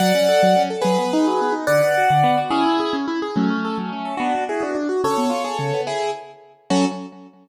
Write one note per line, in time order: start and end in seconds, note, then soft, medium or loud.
0.00 0.12 F#3 medium
0.00 0.62 D5 medium
0.00 0.62 F#5 medium
0.15 0.27 C#4 medium
0.28 0.41 A4 medium
0.43 0.55 F#3 medium
0.56 0.69 C#4 medium
0.70 0.83 A4 medium
0.82 0.97 F#3 medium
0.82 1.54 G#4 medium
0.82 1.54 B4 medium
0.98 1.11 B3 medium
1.13 1.26 D#4 medium
1.27 1.40 F#3 medium
1.41 1.54 B3 medium
1.52 1.65 D#4 medium
1.67 1.80 D3 loud
1.67 2.39 D5 medium
1.67 2.39 F#5 medium
1.82 1.94 B3 medium
1.97 2.10 F#4 medium
2.10 2.23 D3 medium
2.24 2.36 B3 medium
2.37 2.50 F#4 medium
2.50 2.64 C#4 medium
2.50 2.96 E4 medium
2.50 2.96 G#4 medium
2.66 2.78 E4 medium
2.80 2.92 G#4 medium
2.93 3.06 C#4 medium
3.08 3.20 E4 medium
3.22 3.35 G#4 medium
3.36 3.49 F#3 medium
3.36 4.15 A3 medium
3.36 4.15 C#4 medium
3.50 3.63 C#4 medium
3.65 3.77 A4 medium
3.78 3.90 F#3 medium
3.93 4.05 C#4 medium
4.05 4.18 A4 medium
4.17 4.32 B3 loud
4.17 4.44 D4 medium
4.17 4.44 F#4 medium
4.35 4.48 D4 medium
4.49 4.62 E4 medium
4.49 4.61 F#4 medium
4.49 4.62 G#4 medium
4.61 4.73 B3 medium
4.61 4.76 D4 medium
4.61 4.76 F#4 medium
4.75 4.88 D4 medium
4.89 5.02 F#4 medium
5.04 5.16 C#3 medium
5.04 5.81 A4 medium
5.04 5.81 C#5 medium
5.18 5.30 B3 medium
5.30 5.42 F4 medium
5.44 5.57 G#4 medium
5.59 5.71 C#3 medium
5.74 5.86 B3 medium
5.87 6.11 E4 medium
5.87 6.11 G#4 medium
6.70 6.85 F#3 medium
6.70 6.85 C#4 medium
6.70 6.85 F#4 loud
6.70 6.85 A4 medium